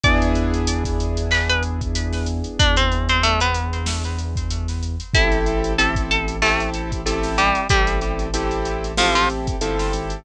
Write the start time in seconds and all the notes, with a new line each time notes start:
0.03 E2 B3 D4 E4 G#4 D5 D6, kick, closed hi-hat
0.22 closed hi-hat
0.35 closed hi-hat
0.54 closed hi-hat
0.67 closed hi-hat
0.84 kick, snare, closed hi-hat
1.00 closed hi-hat
1.17 closed hi-hat
1.31 B4 B5, clap
1.49 B4 B5, closed hi-hat
1.63 closed hi-hat
1.81 kick, closed hi-hat
1.95 closed hi-hat
2.13 snare, closed hi-hat
2.26 closed hi-hat
2.44 closed hi-hat
2.59 E2 D4 D5, kick, closed hi-hat
2.76 C4 C5, closed hi-hat
2.92 closed hi-hat
3.09 C4 C5, closed hi-hat
3.23 A3 A4, closed hi-hat
3.40 B3 B4, closed hi-hat
3.54 closed hi-hat
3.73 closed hi-hat
3.86 snare
4.04 closed hi-hat
4.18 closed hi-hat
4.36 kick, closed hi-hat
4.51 closed hi-hat
4.68 snare, closed hi-hat
4.83 closed hi-hat
5.00 closed hi-hat
5.14 A1 C4 E4 G4 A4 E5, kick, closed hi-hat
5.32 closed hi-hat
5.46 closed hi-hat
5.64 closed hi-hat
5.78 C4 E4 G4 A4 A5, closed hi-hat
5.95 kick, closed hi-hat
6.11 A4 A5, closed hi-hat
6.28 closed hi-hat
6.42 A3 C4 E4 G4 A4, clap
6.60 closed hi-hat
6.74 closed hi-hat
6.92 kick, closed hi-hat
7.06 C4 E4 G4 A4, closed hi-hat
7.23 snare, closed hi-hat
7.38 G3 G4, closed hi-hat
7.55 closed hi-hat
7.69 A1 G3 C4 E4 G4 A4, kick, closed hi-hat
7.87 closed hi-hat
8.01 closed hi-hat
8.19 closed hi-hat
8.34 C4 E4 G4 A4, closed hi-hat
8.51 closed hi-hat
8.65 closed hi-hat
8.84 closed hi-hat
8.97 F3 C4 E4 F4 G4 A4, snare
9.15 F3 F4, closed hi-hat
9.30 closed hi-hat
9.47 kick, closed hi-hat
9.61 G1 C4 E4 G4 A4, closed hi-hat
9.79 snare, closed hi-hat
9.93 G#1, closed hi-hat
10.10 closed hi-hat